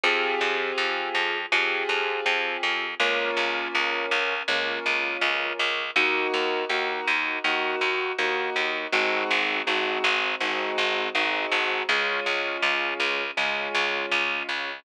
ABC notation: X:1
M:4/4
L:1/8
Q:1/4=81
K:Db
V:1 name="Acoustic Grand Piano"
[CF=GA]4 [CFGA]4 | [B,DF]4 [B,DF]4 | [B,EG]2 [B,EG]2 [B,EG]2 [B,EG]2 | [A,CEG]2 [A,CEG]2 [A,CEG]2 [A,CEG]2 |
[A,DF]4 [A,DF]4 |]
V:2 name="Electric Bass (finger)" clef=bass
F,, F,, F,, F,, F,, F,, F,, F,, | D,, D,, D,, D,, D,, D,, D,, D,, | E,, E,, E,, E,, E,, E,, E,, E,, | A,,, A,,, A,,, A,,, A,,, A,,, A,,, A,,, |
D,, D,, D,, D,, D,, D,, D,, D,, |]